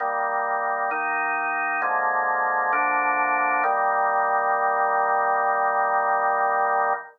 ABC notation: X:1
M:4/4
L:1/8
Q:1/4=66
K:Eb
V:1 name="Drawbar Organ"
[E,G,B,]2 [E,B,E]2 [D,F,A,B,]2 [D,F,B,D]2 | [E,G,B,]8 |]